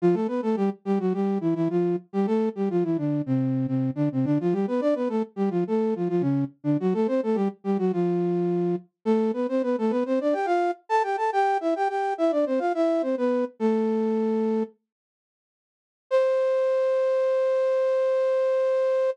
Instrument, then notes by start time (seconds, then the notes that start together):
flute
0.02 F3 F4
0.14 A3 A4
0.27 B3 B4
0.42 A3 A4
0.56 G3 G4
0.85 G3 G4
1.00 F#3 F#4
1.13 G3 G4
1.41 E3 E4
1.55 E3 E4
1.70 F3 F4
2.13 G3 G4
2.26 A3 A4
2.55 G3 G4
2.70 F3 F4
2.83 E3 E4
2.98 D3 D4
3.26 C3 C4
3.67 C3 C4
3.95 D3 D4
4.12 C3 C4
4.25 D3 D4
4.40 F3 F4
4.52 G3 G4
4.67 B3 B4
4.81 D4 D5
4.95 B3 B4
5.09 A3 A4
5.36 G3 G4
5.50 F3 F4
5.67 A3 A4
5.96 F3 F4
6.09 F3 F4
6.21 C#3 C#4
6.64 D3 D4
6.80 F#3 F#4
6.94 A3 A4
7.07 C4 C5
7.23 A3 A4
7.35 G3 G4
7.64 G3 G4
7.78 F#3 F#4
7.93 F3 F4
9.05 A3 A4
9.33 B3 B4
9.49 C4 C5
9.63 B3 B4
9.78 A3 A4
9.90 B3 B4
10.06 C4 C5
10.21 D4 D5
10.33 G4 G5
10.46 F4 F5
10.89 A4 A5
11.03 G4 G5
11.17 A4 A5
11.33 G4 G5
11.61 E4 E5
11.76 G4 G5
11.89 G4 G5
12.18 E4 E5
12.31 D4 D5
12.46 C4 C5
12.59 F4 F5
12.75 E4 E5
13.02 C4 C5
13.17 B3 B4
13.60 A3 A4
16.11 C5